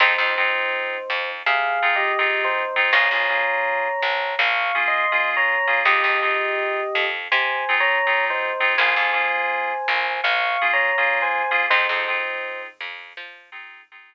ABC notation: X:1
M:4/4
L:1/16
Q:1/4=82
K:Fm
V:1 name="Electric Piano 1"
[Ec]8 (3[Af]4 [Ge]4 [Ec]4 | [db]8 (3[fd']4 [ec']4 [db]4 | [Ge]8 (3[ca]4 [db]4 [Ec]4 | [ca]8 (3[fd']4 [db]4 [ca]4 |
[Ec]6 z10 |]
V:2 name="Electric Piano 2"
[CEFA] [CEFA] [CEFA]8 [CEFA]2 [CEFA]3 [CEFA] | [B,DFA] [B,DFA] [B,DFA]8 [B,DFA]2 [B,DFA]3 [B,DFA] | [CEFA] [CEFA] [CEFA]8 [CEFA]2 [CEFA]3 [CEFA] | [B,DFA] [B,DFA] [B,DFA]8 [B,DFA]2 [B,DFA]3 [B,DFA] |
[CEFA] [CEFA] [CEFA]8 [CEFA]2 [CEFA]3 z |]
V:3 name="Electric Bass (finger)" clef=bass
F,, F,,5 F,,2 C,8 | B,,, B,,,5 B,,,2 B,,,8 | F,, F,,5 F,,2 C,8 | B,,, F,,5 B,,,2 B,,,8 |
F,, F,,5 F,,2 F,8 |]